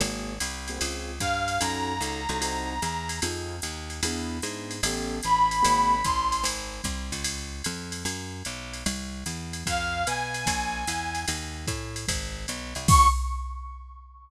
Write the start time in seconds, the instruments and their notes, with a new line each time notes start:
0.00 electric bass (finger) G#1, acoustic grand piano A#3 C4 F#4 G#4, ride
0.40 electric bass (finger) C2, hi-hat pedal, ride
0.68 acoustic grand piano A#3 C4 F#4 G#4, ride
0.78 electric bass (finger) C#2, acoustic grand piano C4 C#4 F4 G#4, ride
1.20 electric bass (finger) G2, brass section F5, kick, hi-hat pedal, ride
1.48 ride
1.60 electric bass (finger) F#2, acoustic grand piano C#4 D#4 F#4 A4, brass section A#5, ride
2.01 electric bass (finger) C#2, acoustic grand piano C#4 D#4 F#4 A4, hi-hat pedal, ride
2.29 electric bass (finger) C2, acoustic grand piano C#4 D#4 F#4 A4, ride
2.41 acoustic grand piano C4 D#4 F#4 A4, ride
2.82 electric bass (finger) E2, hi-hat pedal, ride
3.09 ride
3.22 electric bass (finger) F2, acoustic grand piano C4 D#4 F4 G#4, ride
3.62 electric bass (finger) D#2, hi-hat pedal, ride
3.90 ride
4.03 electric bass (finger) E2, acoustic grand piano B3 D4 E4 G#4, ride
4.42 electric bass (finger) G#2, acoustic grand piano B3 D4 E4 G#4, hi-hat pedal, ride
4.71 ride
4.83 electric bass (finger) A1, acoustic grand piano B3 C#4 G4 A4, ride
5.23 electric bass (finger) A1, brass section B5, hi-hat pedal, ride
5.51 ride
5.62 electric bass (finger) G#1, acoustic grand piano A#3 C4 F#4 G#4, ride
6.04 electric bass (finger) A1, brass section C6, kick, hi-hat pedal, ride
6.32 ride
6.44 electric bass (finger) G#1, ride
6.84 electric bass (finger) C2, kick, hi-hat pedal, ride
7.12 electric bass (finger) C#2, ride
7.24 ride
7.64 electric bass (finger) F2, hi-hat pedal, ride
7.92 ride
8.05 electric bass (finger) F#2, ride
8.45 electric bass (finger) B1, hi-hat pedal, ride
8.73 ride
8.86 electric bass (finger) C2, ride
9.26 electric bass (finger) E2, hi-hat pedal, ride
9.53 ride
9.66 electric bass (finger) F2, brass section F5, kick, ride
10.07 electric bass (finger) B2, brass section G#5, hi-hat pedal, ride
10.34 ride
10.46 electric bass (finger) A#1, kick, ride
10.87 electric bass (finger) E2, hi-hat pedal, ride
11.15 ride
11.28 electric bass (finger) D#2, ride
11.67 electric bass (finger) A2, kick, hi-hat pedal, ride
11.96 ride
12.08 electric bass (finger) G#1, kick, ride
12.48 electric bass (finger) B1, hi-hat pedal, ride
12.75 electric bass (finger) C2, ride
12.88 electric bass (finger) C#2, brass section C#6, kick, crash